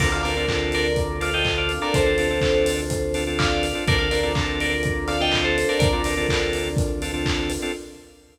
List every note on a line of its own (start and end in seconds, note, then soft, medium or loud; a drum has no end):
0.00 1.78 D2 medium
0.00 0.09 C4 medium
0.00 3.83 C4 medium
0.00 0.09 D4 medium
0.00 3.83 D4 loud
0.00 0.09 F4 medium
0.00 3.83 F4 medium
0.00 0.09 A4 medium
0.00 3.83 A4 medium
0.00 0.12 A#4 medium
0.00 0.11 D5 medium
0.00 kick loud
0.00 crash loud
0.12 0.22 C4 medium
0.12 0.22 D4 medium
0.12 0.22 F4 medium
0.12 0.22 A4 medium
0.12 0.22 D5 medium
0.12 0.23 F5 medium
0.23 0.34 C4 medium
0.23 0.34 D4 medium
0.23 0.34 F4 medium
0.23 0.34 A4 medium
0.23 0.69 A#4 medium
0.23 0.69 D5 medium
0.23 open hi-hat medium
0.37 0.46 C4 medium
0.37 0.46 D4 medium
0.37 0.46 F4 medium
0.37 0.46 A4 medium
0.48 0.88 C4 medium
0.48 0.88 D4 medium
0.48 0.88 F4 medium
0.48 0.88 A4 medium
0.48 kick medium
0.48 clap loud
0.72 1.15 A#4 medium
0.72 1.15 D5 medium
0.72 open hi-hat medium
0.96 kick loud
0.96 closed hi-hat loud
1.21 1.30 C4 medium
1.21 1.30 D4 medium
1.21 1.30 F4 medium
1.21 1.30 A4 medium
1.21 1.34 D5 medium
1.21 1.34 F5 medium
1.21 open hi-hat medium
1.33 1.72 C4 medium
1.33 1.72 D4 medium
1.33 1.72 F4 medium
1.33 1.72 A4 medium
1.33 1.45 D#5 medium
1.33 1.45 G5 medium
1.45 kick medium
1.45 clap loud
1.58 1.79 D5 medium
1.58 1.79 F5 medium
1.69 open hi-hat medium
1.81 2.01 C4 medium
1.81 2.01 D4 medium
1.81 2.01 F4 medium
1.81 2.01 A4 medium
1.81 1.94 A#4 medium
1.81 1.94 D5 medium
1.94 3.73 D2 medium
1.94 3.19 A4 medium
1.94 3.19 C5 medium
1.94 kick loud
1.94 closed hi-hat loud
2.06 2.16 C4 medium
2.06 2.16 D4 medium
2.06 2.16 F4 medium
2.06 2.16 A4 medium
2.18 2.28 C4 medium
2.18 2.28 D4 medium
2.18 2.28 F4 medium
2.18 2.28 A4 medium
2.18 open hi-hat medium
2.31 2.40 C4 medium
2.31 2.40 D4 medium
2.31 2.40 F4 medium
2.31 2.40 A4 medium
2.41 2.81 C4 medium
2.41 2.81 D4 medium
2.41 2.81 F4 medium
2.41 2.81 A4 medium
2.41 kick medium
2.41 clap loud
2.66 open hi-hat loud
2.90 kick medium
2.90 closed hi-hat loud
3.14 3.24 C4 medium
3.14 3.24 D4 medium
3.14 3.24 F4 medium
3.14 3.24 A4 medium
3.14 open hi-hat medium
3.27 3.66 C4 medium
3.27 3.66 D4 medium
3.27 3.66 F4 medium
3.27 3.66 A4 medium
3.39 3.83 D5 medium
3.39 3.83 F5 medium
3.39 kick loud
3.39 clap loud
3.63 open hi-hat medium
3.75 3.84 C4 medium
3.75 3.84 D4 medium
3.75 3.84 F4 medium
3.75 3.84 A4 medium
3.87 5.65 D2 medium
3.87 7.70 C4 medium
3.87 3.97 C4 medium
3.87 7.70 D4 loud
3.87 3.97 D4 medium
3.87 7.70 F4 medium
3.87 3.97 F4 medium
3.87 7.70 A4 medium
3.87 3.97 A4 medium
3.87 3.99 A#4 medium
3.87 3.98 D5 medium
3.87 kick loud
3.87 closed hi-hat loud
3.98 4.09 C4 medium
3.98 4.09 D4 medium
3.98 4.09 F4 medium
3.98 4.09 A4 medium
3.98 4.10 D5 medium
3.98 4.10 F5 medium
4.11 4.21 C4 medium
4.11 4.21 D4 medium
4.11 4.21 F4 medium
4.11 4.21 A4 medium
4.11 4.51 A#4 medium
4.11 4.51 D5 medium
4.11 open hi-hat medium
4.23 4.33 C4 medium
4.23 4.33 D4 medium
4.23 4.33 F4 medium
4.23 4.33 A4 medium
4.35 4.74 C4 medium
4.35 4.74 D4 medium
4.35 4.74 F4 medium
4.35 4.74 A4 medium
4.35 kick loud
4.35 clap loud
4.60 5.06 A#4 medium
4.60 5.06 D5 medium
4.60 open hi-hat medium
4.83 kick loud
4.83 closed hi-hat loud
5.08 5.18 C4 medium
5.08 5.18 D4 medium
5.08 5.18 F4 medium
5.08 5.18 A4 medium
5.08 5.19 D5 medium
5.08 5.19 F5 medium
5.08 open hi-hat medium
5.20 5.59 C4 medium
5.20 5.59 D4 medium
5.20 5.59 F4 medium
5.20 5.59 A4 medium
5.20 5.33 D#5 medium
5.20 5.33 G5 medium
5.32 kick medium
5.32 clap loud
5.44 5.65 A4 medium
5.44 5.65 C5 medium
5.58 open hi-hat medium
5.69 5.88 C4 medium
5.69 5.88 D4 medium
5.69 5.88 F4 medium
5.69 5.88 A4 medium
5.69 5.79 A#4 medium
5.69 5.79 D5 medium
5.79 7.58 D2 medium
5.79 6.77 A#4 medium
5.79 6.77 D5 medium
5.79 kick loud
5.79 closed hi-hat loud
5.93 6.02 C4 medium
5.93 6.02 D4 medium
5.93 6.02 F4 medium
5.93 6.02 A4 medium
6.04 6.15 C4 medium
6.04 6.15 D4 medium
6.04 6.15 F4 medium
6.04 6.15 A4 medium
6.04 open hi-hat loud
6.17 6.27 C4 medium
6.17 6.27 D4 medium
6.17 6.27 F4 medium
6.17 6.27 A4 medium
6.29 6.68 C4 medium
6.29 6.68 D4 medium
6.29 6.68 F4 medium
6.29 6.68 A4 medium
6.29 kick medium
6.29 clap loud
6.53 open hi-hat medium
6.77 kick loud
6.77 closed hi-hat loud
7.02 7.12 C4 medium
7.02 7.12 D4 medium
7.02 7.12 F4 medium
7.02 7.12 A4 medium
7.02 open hi-hat medium
7.14 7.52 C4 medium
7.14 7.52 D4 medium
7.14 7.52 F4 medium
7.14 7.52 A4 medium
7.26 kick loud
7.26 clap loud
7.50 open hi-hat medium
7.62 7.72 C4 medium
7.62 7.72 D4 medium
7.62 7.72 F4 medium
7.62 7.72 A4 medium